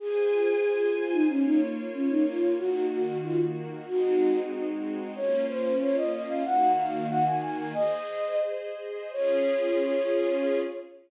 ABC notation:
X:1
M:2/4
L:1/16
Q:1/4=93
K:Db
V:1 name="Flute"
A6 F E | D E z2 D E F2 | G2 G2 F z3 | G4 z4 |
d2 c2 d e e f | g2 f2 g a a a | "^rit." e4 z4 | d8 |]
V:2 name="String Ensemble 1"
[Fca]8 | [B,Fd]8 | [E,B,G]8 | [A,CEG]8 |
[B,DF]8 | [E,B,G]8 | "^rit." [Ace]8 | [DFA]8 |]